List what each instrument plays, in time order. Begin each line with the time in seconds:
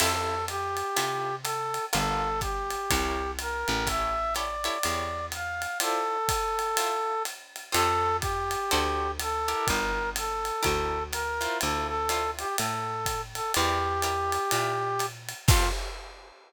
0.00 electric bass (finger) F2, acoustic guitar (steel) C4 E4 F4 A4, brass section A4, crash, ride
0.48 brass section G4, hi-hat pedal, ride
0.77 ride
0.96 electric bass (finger) C3, acoustic guitar (steel) C4 E4 F4 A4, ride
1.43 brass section A4, hi-hat pedal, ride
1.74 ride
1.93 electric bass (finger) G1, acoustic guitar (steel) F4 G4 A4 A#4, brass section A4, ride
2.41 brass section G4, kick, hi-hat pedal, ride
2.70 ride
2.90 electric bass (finger) C2, acoustic guitar (steel) E4 A#4 C5 C#5, kick, ride
3.39 brass section A#4, hi-hat pedal, ride
3.68 electric bass (finger) A1, ride
3.87 acoustic guitar (steel) E4 G4 A4 C#5, brass section E5, kick, ride
4.35 acoustic guitar (steel) E4 G4 A4 C#5, brass section D5, hi-hat pedal, ride
4.64 acoustic guitar (steel) E4 G4 A4 C#5, ride
4.83 electric bass (finger) E2, acoustic guitar (steel) E4 G4 A4 C#5, ride
5.32 brass section F5, hi-hat pedal, ride
5.62 ride
5.80 acoustic guitar (steel) E4 F4 C5 D5, brass section A4, ride
6.29 kick, hi-hat pedal, ride
6.59 ride
6.77 acoustic guitar (steel) E4 F4 C5 D5, ride
7.25 hi-hat pedal, ride
7.56 ride
7.72 electric bass (finger) F2, acoustic guitar (steel) F4 G4 A4 C5, brass section A4, ride
8.20 brass section G4, kick, hi-hat pedal, ride
8.51 ride
8.71 electric bass (finger) D2, acoustic guitar (steel) F#4 A4 C5 D5, ride
9.20 brass section A4, hi-hat pedal, ride
9.48 acoustic guitar (steel) E4 G4 A#4 D5, ride
9.65 brass section A#4, kick, ride
9.70 electric bass (finger) G1
10.16 brass section A4, hi-hat pedal, ride
10.45 ride
10.63 electric bass (finger) D2, acoustic guitar (steel) E4 G4 A#4 D5, kick, ride
11.12 brass section A#4, hi-hat pedal, ride
11.41 acoustic guitar (steel) E4 F4 C5 D5, ride
11.61 electric bass (finger) D2, brass section A4, ride
11.88 brass section A4
12.09 acoustic guitar (steel) E4 F4 C5 D5, hi-hat pedal, ride
12.39 brass section G4, ride
12.58 electric bass (finger) A2, brass section A4, ride
13.06 kick, hi-hat pedal, ride
13.35 brass section A4, ride
13.54 electric bass (finger) E2, acoustic guitar (steel) E4 G4 A#4 D5, brass section G4, ride
14.02 acoustic guitar (steel) E4 G4 A#4 D5, hi-hat pedal, ride
14.32 ride
14.51 electric bass (finger) A#2, acoustic guitar (steel) E4 G4 A#4 D5, ride
14.99 hi-hat pedal, ride
15.29 ride
15.48 electric bass (finger) F2, acoustic guitar (steel) C4 F4 G4 A4, brass section F4, kick, crash